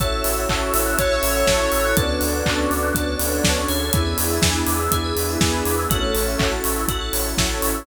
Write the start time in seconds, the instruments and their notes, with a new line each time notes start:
0.00 synth bass 2 A1, pad 2 (warm) C#4 E4 F#4 A4, electric piano 2 C#4 E4 F#4 A4, tubular bells A4, choir aahs C#5 E5, kick, closed hi-hat
0.12 tubular bells C#5
0.24 synth bass 2 A1, tubular bells E5, open hi-hat
0.37 tubular bells F#5
0.49 synth bass 2 A1, electric piano 2 C#4 E4 F#4 A4, tubular bells A5, kick, clap
0.61 tubular bells C#6
0.74 synth bass 2 A1, tubular bells E6, open hi-hat
0.86 tubular bells F#6
0.97 synth bass 2 A1, electric piano 2 C#4 E4 F#4 A4, pad 2 (warm) C#4 E4 A4 C#5, tubular bells A4, lead 1 (square) C#5, kick, closed hi-hat
1.11 tubular bells C#5
1.23 synth bass 2 A1, tubular bells E5, open hi-hat
1.35 tubular bells F#5
1.47 synth bass 2 A1, electric piano 2 C#4 E4 F#4 A4, tubular bells A5, kick, snare
1.60 tubular bells C#6
1.72 synth bass 2 A1, tubular bells E6, open hi-hat
1.85 tubular bells F#6
1.97 synth bass 2 D2, choir aahs B3 D4, pad 2 (warm) C#4 D4 F#4 A4, electric piano 2 C#4 D4 F#4 A4, tubular bells A4, kick, closed hi-hat
2.09 tubular bells C#5
2.21 synth bass 2 D2, tubular bells D5, open hi-hat
2.34 tubular bells F#5
2.46 synth bass 2 D2, electric piano 2 C#4 D4 F#4 A4, tubular bells A5, kick, clap
2.58 tubular bells C#6
2.70 synth bass 2 D2, tubular bells D6, open hi-hat
2.83 tubular bells F#6
2.94 synth bass 2 D2, pad 2 (warm) C#4 D4 A4 C#5, electric piano 2 C#4 D4 F#4 A4, tubular bells A4, kick, closed hi-hat
3.07 tubular bells C#5
3.19 synth bass 2 D2, tubular bells D5, open hi-hat
3.32 tubular bells F#5
3.43 synth bass 2 D2, electric piano 2 C#4 D4 F#4 A4, tubular bells A5, kick, snare
3.57 tubular bells C#6
3.68 synth bass 2 D2, tubular bells G#4, open hi-hat
3.93 synth bass 2 E2, electric piano 2 B3 D4 E4 G#4, pad 2 (warm) B3 D4 E4 G#4, choir aahs E4 G#4, kick, closed hi-hat
4.06 tubular bells B4
4.18 synth bass 2 E2, tubular bells D5, open hi-hat
4.30 tubular bells E5
4.42 synth bass 2 E2, electric piano 2 B3 D4 E4 G#4, tubular bells G#5, kick, snare
4.55 tubular bells B5
4.67 synth bass 2 E2, tubular bells D6, open hi-hat
4.80 tubular bells E6
4.91 synth bass 2 E2, pad 2 (warm) B3 D4 G#4 B4, electric piano 2 B3 D4 E4 G#4, tubular bells G#4, kick, closed hi-hat
5.04 tubular bells B4
5.16 synth bass 2 E2, tubular bells D5, open hi-hat
5.29 tubular bells E5
5.41 synth bass 2 E2, electric piano 2 B3 D4 E4 G#4, tubular bells G#5, kick, snare
5.53 tubular bells B5
5.65 synth bass 2 E2, tubular bells D6, open hi-hat
5.78 tubular bells E6
5.90 synth bass 2 A1, choir aahs A3 C#4, pad 2 (warm) C#4 E4 F#4 A4, electric piano 2 C#4 E4 F#4 A4, tubular bells F#4, kick, closed hi-hat
6.02 tubular bells A4
6.15 synth bass 2 A1, tubular bells C#5, open hi-hat
6.27 tubular bells E5
6.38 synth bass 2 A1, electric piano 2 C#4 E4 F#4 A4, tubular bells F#5, kick, clap
6.52 tubular bells A5
6.64 synth bass 2 A1, tubular bells C#6, open hi-hat
6.76 tubular bells E6
6.88 synth bass 2 A1, electric piano 2 C#4 E4 F#4 A4, pad 2 (warm) C#4 E4 A4 C#5, tubular bells F#4, kick, closed hi-hat
7.01 tubular bells A4
7.13 synth bass 2 A1, tubular bells C#5, open hi-hat
7.25 tubular bells E5
7.38 synth bass 2 A1, electric piano 2 C#4 E4 F#4 A4, tubular bells F#5, kick, snare
7.50 tubular bells A5
7.62 synth bass 2 A1, tubular bells C#6, open hi-hat
7.75 tubular bells E6